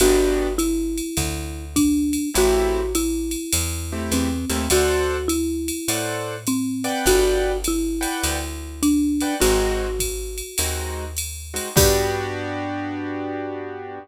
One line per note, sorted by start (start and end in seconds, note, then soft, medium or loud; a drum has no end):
0.00 1.01 G1 medium
0.00 0.48 B3 loud
0.00 0.48 D4 loud
0.00 0.54 F#4 loud
0.00 0.48 F#4 medium
0.00 0.48 G4 medium
0.00 ride medium
0.58 1.65 E4 medium
0.58 hi-hat pedal medium
0.58 ride medium
0.98 ride medium
1.17 2.18 D2 medium
1.17 kick medium
1.17 ride medium
1.76 2.30 D4 medium
1.76 kick medium
1.76 hi-hat pedal medium
1.76 ride medium
2.13 ride medium
2.34 3.36 A1 medium
2.34 2.81 A3 loud
2.34 2.81 C4 loud
2.34 2.81 E4 loud
2.34 2.93 F#4 loud
2.34 2.81 G4 loud
2.34 ride medium
2.95 4.01 E4 medium
2.95 hi-hat pedal medium
2.95 ride medium
3.31 ride medium
3.53 4.10 E2 medium
3.53 ride loud
3.92 4.29 A3 medium
3.92 4.29 C4 medium
3.92 4.29 E4 medium
3.92 4.29 G4 medium
4.11 4.45 E2 medium
4.11 4.70 C4 medium
4.11 hi-hat pedal medium
4.11 ride medium
4.50 4.69 D#2 medium
4.50 4.64 A3 loud
4.50 4.64 C4 medium
4.50 4.64 E4 medium
4.50 4.64 G4 medium
4.50 ride medium
4.70 5.71 D2 medium
4.70 5.28 F#4 medium
4.70 5.17 A4 loud
4.70 5.17 C5 loud
4.70 5.17 D5 loud
4.70 5.17 F#5 loud
4.70 ride medium
5.28 6.38 E4 medium
5.28 hi-hat pedal medium
5.28 ride medium
5.68 ride medium
5.88 6.89 A2 medium
5.88 6.35 A4 medium
5.88 6.35 C5 medium
5.88 6.35 D5 medium
5.88 6.35 F#5 medium
5.88 ride medium
6.47 7.06 C4 medium
6.47 hi-hat pedal medium
6.47 ride medium
6.84 7.52 B4 medium
6.84 7.52 D5 loud
6.84 7.52 F#5 loud
6.84 7.52 G5 loud
6.84 ride medium
7.06 8.06 G1 loud
7.06 7.58 F#4 loud
7.06 kick soft
7.06 ride medium
7.64 8.81 E4 medium
7.64 hi-hat pedal medium
7.64 ride medium
8.01 8.37 B4 medium
8.01 8.37 D5 medium
8.01 8.37 F#5 loud
8.01 8.37 G5 medium
8.01 ride medium
8.23 9.24 D2 medium
8.23 ride medium
8.83 9.34 D4 medium
8.83 hi-hat pedal medium
8.83 ride medium
9.20 9.36 B4 medium
9.20 9.36 D5 medium
9.20 9.36 F#5 medium
9.20 9.36 G5 medium
9.20 ride medium
9.40 10.42 G#1 loud
9.40 9.86 G#3 loud
9.40 9.86 C4 loud
9.40 9.86 D#4 medium
9.40 9.86 F#4 loud
9.40 10.94 F#4 medium
9.40 ride medium
9.99 kick soft
9.99 hi-hat pedal medium
9.99 ride medium
10.38 ride medium
10.58 11.59 D#2 medium
10.58 11.04 G#3 medium
10.58 11.04 C4 medium
10.58 11.04 D#4 medium
10.58 11.04 F#4 medium
10.58 ride medium
11.17 hi-hat pedal medium
11.17 ride medium
11.54 11.69 G#3 medium
11.54 11.69 C4 medium
11.54 11.69 D#4 medium
11.54 11.69 F#4 medium
11.54 ride medium
11.76 13.99 G2 loud
11.76 13.98 B3 medium
11.76 13.98 D4 loud
11.76 13.98 F#4 loud
11.76 13.98 G4 loud
11.76 14.00 G4 loud
11.76 kick loud
11.76 crash loud